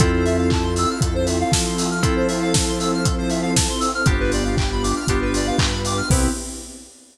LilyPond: <<
  \new Staff \with { instrumentName = "Electric Piano 2" } { \time 4/4 \key c \major \tempo 4 = 118 <c' e' f' a'>1 | <c' e' f' a'>1 | <b d' f' g'>2 <b d' f' g'>2 | <b c' e' g'>4 r2. | }
  \new Staff \with { instrumentName = "Lead 1 (square)" } { \time 4/4 \key c \major a'16 c''16 e''16 f''16 a''16 c'''16 e'''16 f'''16 a'16 c''16 e''16 f''16 a''16 c'''16 e'''16 f'''16 | a'16 c''16 e''16 f''16 a''16 c'''16 e'''16 f'''16 a'16 c''16 e''16 f''16 a''16 c'''16 e'''16 f'''16 | g'16 b'16 d''16 f''16 g''16 b''16 d'''16 f'''16 g'16 b'16 d''16 f''16 g''16 b''16 d'''16 f'''16 | <b' c'' e'' g''>4 r2. | }
  \new Staff \with { instrumentName = "Synth Bass 1" } { \clef bass \time 4/4 \key c \major f,2 f,4 f4~ | f1 | g,,2 g,,4 g,4 | c,4 r2. | }
  \new Staff \with { instrumentName = "Pad 2 (warm)" } { \time 4/4 \key c \major <c' e' f' a'>1 | <c' e' a' c''>1 | <b d' f' g'>2 <b d' g' b'>2 | <b c' e' g'>4 r2. | }
  \new DrumStaff \with { instrumentName = "Drums" } \drummode { \time 4/4 <hh bd>8 hho8 <hc bd>8 hho8 <hh bd>8 hho8 <bd sn>8 hho8 | <hh bd>8 hho8 <bd sn>8 hho8 <hh bd>8 hho8 <bd sn>8 hho8 | <hh bd>8 hho8 <hc bd>8 hho8 <hh bd>8 hho8 <hc bd>8 hho8 | <cymc bd>4 r4 r4 r4 | }
>>